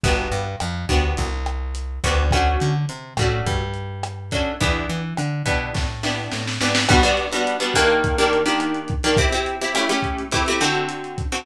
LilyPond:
<<
  \new Staff \with { instrumentName = "Acoustic Guitar (steel)" } { \time 4/4 \key e \minor \tempo 4 = 105 <b d' fis' g'>4. <b d' fis' g'>2 <b d' fis' g'>8 | <a cis' d' fis'>4. <a cis' d' fis'>2 <a cis' d' fis'>8 | <b d' e' g'>4. <b d' e' g'>4 <b d' e' g'>4 <b d' e' g'>8 | \key g \major <g b d' fis'>16 <g b d' fis'>8 <g b d' fis'>8 <g b d' fis'>16 <ees bes d' g'>8. <ees bes d' g'>8 <ees bes d' g'>4 <ees bes d' g'>16 |
<c' e' g'>16 <c' e' g'>8 <c' e' g'>16 <a cis' e' g'>16 <a cis' e' g'>8. <a c' e' g'>16 <a c' e' g'>16 <d c' fis' a'>4~ <d c' fis' a'>16 <d c' fis' a'>16 | }
  \new Staff \with { instrumentName = "Electric Bass (finger)" } { \clef bass \time 4/4 \key e \minor g,,8 g,8 f,8 d,8 c,4. d,8~ | d,8 d8 c8 a,8 g,2 | e,8 e8 d8 b,8 a,4 a,8 gis,8 | \key g \major r1 |
r1 | }
  \new DrumStaff \with { instrumentName = "Drums" } \drummode { \time 4/4 <hh bd>8 hh8 <hh ss>8 <hh bd>8 <hh bd>8 <hh ss>8 hh8 <hh bd>8 | <hh bd ss>8 hh8 hh8 <hh bd ss>8 <hh bd>8 hh8 <hh ss>8 <hh bd>8 | <hh bd>8 hh8 <hh ss>8 <hh bd>8 <bd sn>8 sn8 sn16 sn16 sn16 sn16 | <cymc bd ss>16 hh16 hh16 hh16 hh16 hh16 <hh bd ss>16 hh16 <hh bd>16 hh16 hh16 hh16 <hh ss>16 hh16 <hh bd>16 hh16 |
<hh bd>16 hh16 hh16 hh16 <hh ss>16 hh16 <hh bd>16 hh16 <hh bd>16 hh16 <hh ss>16 hh16 hh16 hh16 <hh bd>16 hh16 | }
>>